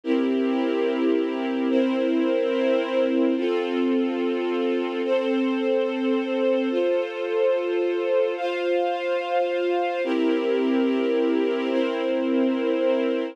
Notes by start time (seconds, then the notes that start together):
0.04 C4 E4 G4 A#4
1.70 C4 E4 A#4 C5
3.36 C4 F4 A4
5.04 C4 A4 C5
6.70 F4 A4 C5
8.37 F4 C5 F5
10.04 C4 E4 G4 A#4
11.70 C4 E4 A#4 C5